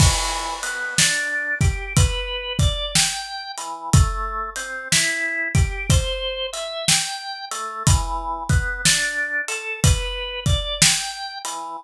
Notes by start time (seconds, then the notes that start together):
0.00 E3, kick, crash
0.63 B3, closed hi-hat
0.98 D4, snare
1.61 G4, kick, closed hi-hat
1.97 B4, kick, closed hi-hat
2.59 D5, kick, closed hi-hat
2.95 G5, snare
3.58 E3, closed hi-hat
3.93 A3, kick, closed hi-hat
4.56 C4, closed hi-hat
4.92 E4, snare
5.55 G4, kick, closed hi-hat
5.90 C5, kick, closed hi-hat
6.53 E5, closed hi-hat
6.88 G5, snare
7.51 A3, closed hi-hat
7.87 E3, kick, closed hi-hat
8.49 B3, kick, closed hi-hat
8.85 D4, snare
9.48 A4, closed hi-hat
9.84 B4, kick, closed hi-hat
10.46 D5, kick, closed hi-hat
10.82 G5, snare
11.45 E3, closed hi-hat